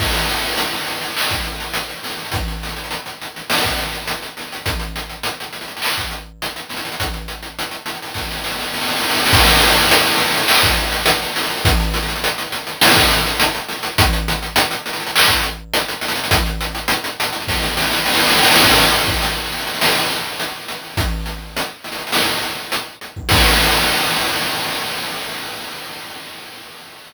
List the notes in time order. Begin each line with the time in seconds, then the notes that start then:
0.00 kick, crash
0.14 closed hi-hat
0.29 closed hi-hat
0.36 closed hi-hat
0.43 closed hi-hat
0.52 closed hi-hat
0.57 closed hi-hat
0.73 closed hi-hat
0.87 closed hi-hat
1.02 closed hi-hat
1.17 clap
1.30 kick, closed hi-hat
1.44 closed hi-hat
1.60 closed hi-hat
1.74 closed hi-hat
1.89 closed hi-hat
2.03 snare, closed hi-hat
2.10 closed hi-hat
2.18 closed hi-hat
2.25 closed hi-hat
2.32 kick, closed hi-hat
2.48 closed hi-hat
2.63 closed hi-hat
2.69 closed hi-hat
2.76 closed hi-hat
2.84 closed hi-hat
2.91 closed hi-hat
3.06 closed hi-hat
3.21 closed hi-hat
3.36 closed hi-hat
3.50 snare
3.63 kick, closed hi-hat
3.79 closed hi-hat
3.93 closed hi-hat
4.08 closed hi-hat
4.22 closed hi-hat
4.37 snare, closed hi-hat
4.52 closed hi-hat
4.66 kick, closed hi-hat
4.79 closed hi-hat
4.96 closed hi-hat
5.09 closed hi-hat
5.23 closed hi-hat
5.40 closed hi-hat
5.53 closed hi-hat
5.61 closed hi-hat
5.68 closed hi-hat
5.77 closed hi-hat
5.82 clap
5.98 kick, closed hi-hat
6.11 closed hi-hat
6.42 closed hi-hat
6.56 closed hi-hat
6.69 snare, closed hi-hat
6.77 closed hi-hat
6.85 closed hi-hat
6.92 closed hi-hat
7.00 kick, closed hi-hat
7.13 closed hi-hat
7.28 closed hi-hat
7.43 closed hi-hat
7.59 closed hi-hat
7.71 closed hi-hat
7.86 closed hi-hat
7.94 closed hi-hat
8.02 closed hi-hat
8.08 closed hi-hat
8.14 kick, snare
8.31 snare
8.44 snare
8.59 snare
8.74 snare
8.81 snare
8.88 snare
8.96 snare
9.03 snare
9.09 snare
9.16 snare
9.26 snare
9.33 kick, crash
9.47 closed hi-hat
9.61 closed hi-hat
9.69 closed hi-hat
9.76 closed hi-hat
9.82 closed hi-hat
9.91 closed hi-hat
10.06 closed hi-hat
10.18 closed hi-hat
10.34 closed hi-hat
10.48 clap
10.63 kick, closed hi-hat
10.77 closed hi-hat
10.92 closed hi-hat
11.06 closed hi-hat
11.23 closed hi-hat
11.36 snare, closed hi-hat
11.43 closed hi-hat
11.50 closed hi-hat
11.57 closed hi-hat
11.65 kick, closed hi-hat
11.80 closed hi-hat
11.94 closed hi-hat
12.03 closed hi-hat
12.08 closed hi-hat
12.16 closed hi-hat
12.24 closed hi-hat
12.38 closed hi-hat
12.52 closed hi-hat
12.67 closed hi-hat
12.81 snare
12.96 kick, closed hi-hat
13.10 closed hi-hat
13.27 closed hi-hat
13.40 closed hi-hat
13.55 closed hi-hat
13.68 snare, closed hi-hat
13.83 closed hi-hat
13.98 kick, closed hi-hat
14.13 closed hi-hat
14.28 closed hi-hat
14.42 closed hi-hat
14.56 closed hi-hat
14.71 closed hi-hat
14.86 closed hi-hat
14.93 closed hi-hat
15.00 closed hi-hat
15.07 closed hi-hat
15.16 clap
15.28 kick, closed hi-hat
15.43 closed hi-hat
15.74 closed hi-hat
15.88 closed hi-hat
16.01 snare, closed hi-hat
16.08 closed hi-hat
16.15 closed hi-hat
16.24 closed hi-hat
16.31 kick, closed hi-hat
16.46 closed hi-hat
16.61 closed hi-hat
16.75 closed hi-hat
16.88 closed hi-hat
17.04 closed hi-hat
17.20 closed hi-hat
17.25 closed hi-hat
17.33 closed hi-hat
17.40 closed hi-hat
17.48 kick, snare
17.62 snare
17.77 snare
17.92 snare
18.06 snare
18.14 snare
18.20 snare
18.28 snare
18.36 snare
18.43 snare
18.50 snare
18.56 snare
18.64 kick, crash
18.92 snare, closed hi-hat
19.08 kick
19.22 closed hi-hat
19.52 closed hi-hat
19.58 closed hi-hat
19.67 closed hi-hat
19.74 closed hi-hat
19.81 snare
20.10 closed hi-hat
20.40 closed hi-hat
20.68 closed hi-hat
20.83 snare
20.97 kick, closed hi-hat
21.26 closed hi-hat
21.57 closed hi-hat
21.84 closed hi-hat
21.92 closed hi-hat
21.98 closed hi-hat
22.07 closed hi-hat
22.12 snare
22.42 closed hi-hat
22.72 closed hi-hat
23.01 closed hi-hat
23.16 kick
23.29 kick, crash